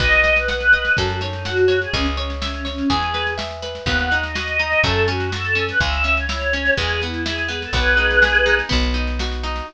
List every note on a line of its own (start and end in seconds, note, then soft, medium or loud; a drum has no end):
0.00 0.89 B1 medium
0.00 0.90 B4 loud
0.00 0.34 D#5 loud
0.00 kick loud
0.00 snare medium
0.12 snare medium
0.24 0.73 D#5 medium
0.24 snare medium
0.36 0.48 B4 loud
0.36 snare medium
0.48 0.92 B4 loud
0.48 0.95 F#5 loud
0.48 snare loud
0.60 snare medium
0.73 0.97 D#5 medium
0.73 snare medium
0.85 snare medium
0.96 1.87 F#2 medium
0.96 1.19 F#4 medium
0.96 1.90 A4 medium
0.96 kick medium
0.96 snare medium
1.09 snare medium
1.21 1.45 D#4 loud
1.21 1.68 C#5 medium
1.21 snare medium
1.33 snare medium
1.44 1.79 F#4 loud
1.44 1.92 F#5 medium
1.44 snare loud
1.57 snare medium
1.68 1.91 C#5 medium
1.68 snare medium
1.81 1.92 G#4 loud
1.81 snare medium
1.93 2.82 C#2 medium
1.93 2.06 C#4 loud
1.93 2.86 G#4 loud
1.93 kick medium
1.93 snare medium
2.06 snare medium
2.17 2.31 C#4 medium
2.17 2.64 C#5 medium
2.17 snare medium
2.30 snare medium
2.42 2.66 C#4 loud
2.42 2.88 E5 medium
2.42 snare loud
2.54 snare medium
2.65 2.89 C#4 medium
2.65 2.88 C#5 medium
2.65 snare medium
2.78 snare medium
2.90 3.79 E2 medium
2.90 3.82 G#4 loud
2.90 3.30 G#4 medium
2.90 kick medium
2.90 snare medium
3.02 snare medium
3.14 3.62 B4 medium
3.14 snare medium
3.27 snare medium
3.38 3.84 E5 medium
3.38 snare loud
3.51 snare medium
3.62 3.85 B4 medium
3.62 snare medium
3.75 snare medium
3.86 4.75 D#2 medium
3.86 4.09 B3 medium
3.86 4.19 F#5 loud
3.86 kick loud
3.86 snare medium
3.99 snare medium
4.11 4.33 D#4 medium
4.11 snare medium
4.23 4.35 D#5 medium
4.23 snare medium
4.35 4.57 F#4 medium
4.35 4.79 D#5 medium
4.35 snare loud
4.48 snare medium
4.59 4.81 D#4 medium
4.59 snare medium
4.72 snare medium
4.82 5.73 F#2 loud
4.82 5.06 A3 medium
4.82 5.04 A4 loud
4.82 kick loud
4.82 snare medium
4.96 snare medium
5.08 5.30 C#4 medium
5.08 5.30 F#4 loud
5.08 snare medium
5.20 snare medium
5.32 5.55 F#4 medium
5.32 5.64 A4 medium
5.32 snare loud
5.44 snare medium
5.55 5.77 C#4 medium
5.55 snare medium
5.68 5.79 B4 loud
5.68 snare medium
5.80 6.69 C#2 medium
5.80 6.02 G#3 medium
5.80 6.14 E5 loud
5.80 kick loud
5.80 snare medium
5.93 snare medium
6.04 6.26 C#4 medium
6.04 snare medium
6.17 6.28 C#5 loud
6.17 snare medium
6.29 6.51 E4 medium
6.29 6.70 C#5 loud
6.29 snare loud
6.41 snare medium
6.53 6.75 C#4 medium
6.53 snare medium
6.65 snare medium
6.77 7.67 E2 medium
6.77 6.99 G#3 medium
6.77 7.00 G#4 loud
6.77 kick medium
6.77 snare medium
6.90 snare medium
7.01 7.24 B3 medium
7.01 7.21 E4 loud
7.01 snare medium
7.14 snare medium
7.26 7.47 E4 medium
7.26 7.58 G#4 loud
7.26 snare loud
7.38 snare medium
7.48 7.70 B3 medium
7.48 snare medium
7.62 7.75 A4 medium
7.62 snare medium
7.73 8.62 B1 medium
7.73 8.66 B3 loud
7.73 8.57 G#4 loud
7.73 8.57 B4 loud
7.73 kick medium
7.73 snare medium
7.97 8.45 D#4 medium
7.97 snare medium
8.10 snare medium
8.22 8.68 G#4 medium
8.22 snare loud
8.35 snare medium
8.46 8.69 D#4 medium
8.46 snare medium
8.59 snare medium
8.69 9.61 B1 loud
8.69 9.61 B3 loud
8.69 kick loud
8.69 snare medium
8.83 snare medium
8.94 9.43 D#4 medium
8.94 snare medium
9.07 snare medium
9.19 9.66 F#4 medium
9.19 snare loud
9.31 snare medium
9.43 9.66 D#4 medium
9.43 snare medium
9.56 snare medium